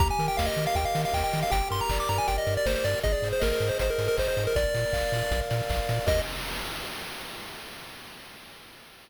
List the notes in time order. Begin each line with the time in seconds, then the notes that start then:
0.00 D#2 G4 A#5, kick, closed hi-hat
0.11 G#5
0.19 D#3 A#4, open hi-hat
0.28 G5
0.37 D#2 D#5 F5, kick, snare
0.46 D#5
0.57 D#3 A#4, open hi-hat
0.67 F5
0.75 D#2 G4 G5, kick, closed hi-hat
0.85 F5
0.94 D#3 A#4, open hi-hat
1.05 F5
1.13 D#2 D#5 G5, kick, clap
1.24 G5
1.33 D#3 A#4, open hi-hat
1.43 F5
1.50 G1 G4 G5, kick, closed hi-hat
1.70 G2 A#4 C6, open hi-hat
1.81 A#5
1.89 G1 D5, kick, clap
2.00 D6
2.09 G2 A#4 A#5, open hi-hat
2.18 G#5
2.27 G1 G4 G5, kick, closed hi-hat
2.38 D#5
2.46 G2 A#4, open hi-hat
2.57 D5
2.66 G1 C5 D5, kick, snare
2.75 C5
2.84 G2 A#4 D5, open hi-hat
3.03 G#1 G#4 D#5, kick, closed hi-hat
3.12 D5
3.22 G#2 C5, open hi-hat
3.33 C5
3.40 G#1 A#4 D#5, kick, snare
3.52 A#4
3.60 G#2 C5, open hi-hat
3.69 C5
3.79 G#1 G#4 C5, kick, closed hi-hat
3.90 A#4
3.98 G#2 C5, open hi-hat
4.08 A#4
4.17 G#1 C5 D#5, kick, clap
4.28 C5
4.37 G#2 C5, open hi-hat
4.47 A#4
4.56 A#1 A#4 D5, kick, closed hi-hat
4.74 A#2 D5, open hi-hat
4.93 A#1 F5, kick, clap
5.12 A#2 D5, open hi-hat
5.31 A#1 A#4, kick, closed hi-hat
5.50 A#2 D5, open hi-hat
5.69 A#1 F5, kick, clap
5.89 A#2 D5, open hi-hat
6.06 D#2 G4 A#4 D#5, kick, crash